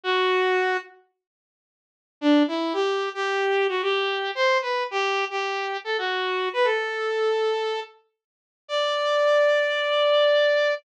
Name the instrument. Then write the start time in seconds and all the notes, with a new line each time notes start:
lead 2 (sawtooth)
0.04 F#4
2.21 D4
2.48 E4
2.73 G4
3.14 G4
3.69 F#4
3.82 G4
4.35 C5
4.62 B4
4.91 G4
5.30 G4
5.84 A4
5.98 F#4
6.53 B4
6.64 A4
8.68 D5